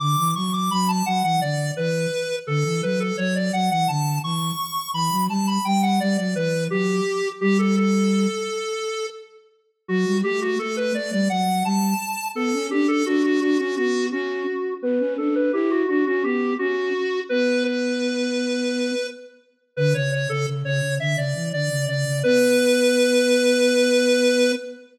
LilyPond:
<<
  \new Staff \with { instrumentName = "Lead 1 (square)" } { \time 7/8 \key b \minor \tempo 4 = 85 d'''8 cis'''16 d'''16 b''16 a''16 fis''16 fis''16 d''8 b'4 | a'8 b'16 a'16 cis''16 d''16 fis''16 fis''16 a''8 cis'''4 | b''8 a''16 b''16 g''16 fis''16 d''16 d''16 b'8 g'4 | g'16 a'16 a'2 r4 |
fis'8 g'16 fis'16 a'16 b'16 d''16 d''16 fis''8 a''4 | a'8 g'16 a'16 fis'16 fis'16 fis'16 fis'16 fis'8 fis'4 | b'8 a'16 b'16 g'16 fis'16 fis'16 fis'16 g'8 fis'4 | b'8 b'2~ b'8 r8 |
b'16 cis''16 cis''16 a'16 r16 cis''8 e''16 d''8 d''8 d''8 | b'2.~ b'8 | }
  \new Staff \with { instrumentName = "Flute" } { \time 7/8 \key b \minor d16 e16 fis8 fis8 fis16 e16 d8 e8 r8 | d16 e16 fis8 fis8 fis16 e16 d8 e8 r8 | e16 fis16 g8 g8 g16 fis16 e8 fis8 r8 | g4. r2 |
fis16 g16 a8 a8 a16 g16 fis8 g8 r8 | b16 cis'16 d'8 d'8 d'16 cis'16 b8 cis'8 r8 | b16 cis'16 d'8 e'8 d'16 cis'16 b8 cis'8 r8 | b2~ b8 r4 |
d16 cis8 cis16 cis16 cis16 cis16 d16 cis16 e16 d16 cis16 cis16 cis16 | b2.~ b8 | }
>>